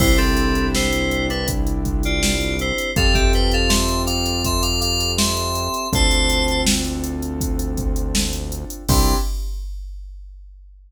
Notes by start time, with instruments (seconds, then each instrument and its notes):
0.00 synth bass 1 C2, acoustic grand piano C4 D4 E4 G4, electric piano 2 E4 C5, kick, crash
0.18 electric piano 2 C4 A4, closed hi-hat
0.37 closed hi-hat
0.55 closed hi-hat
0.75 electric piano 2 E4 C5, snare
0.93 closed hi-hat
1.11 closed hi-hat
1.30 electric piano 2 D4 B4, closed hi-hat
1.48 kick, closed hi-hat
1.67 closed hi-hat
1.85 kick, closed hi-hat
2.03 electric piano 2 F4 D5, closed hi-hat
2.23 snare
2.41 closed hi-hat
2.59 electric piano 2 E4 C5, closed hi-hat
2.78 closed hi-hat
2.96 synth bass 1 F2, acoustic grand piano C4 F4 G4 A4, electric piano 2 A4 F5, kick, closed hi-hat
3.14 electric piano 2 G4 E5, kick, closed hi-hat
3.33 electric piano 2 B4 G5, closed hi-hat
3.52 electric piano 2 A4 F5, closed hi-hat
3.69 electric piano 2 E5 C6, snare
3.88 closed hi-hat
4.06 electric piano 2 F5 D6, closed hi-hat
4.26 closed hi-hat
4.44 electric piano 2 E5 C6, kick, closed hi-hat
4.62 electric piano 2 F5 D6, closed hi-hat
4.80 electric piano 2 F5 D6, closed hi-hat
5.00 closed hi-hat
5.18 electric piano 2 E5 C6, snare
5.37 closed hi-hat
5.55 closed hi-hat
5.74 closed hi-hat
5.93 synth bass 1 D2, acoustic grand piano C4 D4 F4 A4, electric piano 2 C5 A5, kick, closed hi-hat
6.11 closed hi-hat
6.30 closed hi-hat
6.48 closed hi-hat
6.67 snare
6.85 closed hi-hat
7.04 closed hi-hat
7.22 closed hi-hat
7.41 kick, closed hi-hat
7.59 closed hi-hat
7.77 kick, closed hi-hat
7.96 closed hi-hat
8.15 snare
8.33 closed hi-hat
8.52 closed hi-hat
8.70 closed hi-hat
8.89 synth bass 1 C2, acoustic grand piano C4 D4 E4 G4, electric piano 2 C6, kick, crash